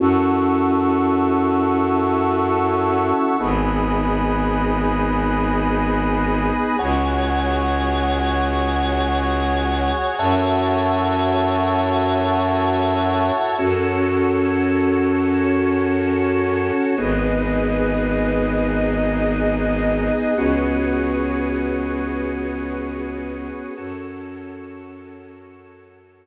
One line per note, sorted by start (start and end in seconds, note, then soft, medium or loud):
0.00 3.13 F#2 medium
0.00 3.36 C#4 medium
0.00 3.36 E4 medium
0.00 3.36 F#4 medium
0.00 3.36 A4 medium
0.00 3.37 F#5 medium
0.00 3.37 A5 medium
0.00 3.37 C#6 medium
0.00 3.37 E6 medium
3.39 6.52 G#1 loud
3.39 6.76 B3 medium
3.39 6.76 D#4 medium
3.39 6.76 G#4 medium
3.39 6.75 G#5 medium
3.39 6.75 B5 medium
3.39 6.75 D#6 medium
6.79 9.92 C#2 loud
6.79 10.16 F#4 medium
6.79 10.16 G#4 medium
6.79 10.15 C#5 medium
6.79 10.16 C#5 medium
6.79 10.15 F#5 medium
6.79 10.15 G#5 medium
10.19 13.31 F#2 loud
10.19 13.55 E4 medium
10.19 13.55 F#4 medium
10.19 13.55 A4 medium
10.19 13.55 C#5 medium
10.19 13.55 E5 medium
10.19 13.55 F#5 medium
10.19 13.55 A5 medium
13.58 16.71 F#2 medium
13.58 16.95 C#4 medium
13.58 15.27 F#4 medium
13.58 16.95 F#4 loud
13.58 15.27 A4 medium
13.58 16.95 A4 medium
13.58 15.27 C#5 medium
15.28 16.96 C#4 medium
15.28 16.96 F#4 medium
15.28 16.96 C#5 medium
16.98 20.11 G#1 loud
16.98 20.34 B3 medium
16.98 20.34 D#4 medium
16.98 20.34 G#4 medium
16.98 18.66 G#4 medium
16.98 18.66 B4 medium
16.98 18.66 D#5 medium
18.68 20.36 D#4 medium
18.68 20.36 G#4 medium
18.68 20.36 D#5 medium
20.37 23.50 C#2 medium
20.37 23.74 B3 medium
20.37 23.74 C#4 medium
20.37 23.74 F#4 medium
20.37 23.74 G#4 medium
20.37 23.74 B4 medium
20.37 23.74 C#5 medium
23.77 26.26 F#2 medium
23.77 26.26 C#4 medium
23.77 26.26 F#4 medium
23.77 26.26 A4 medium
23.77 26.26 C#5 medium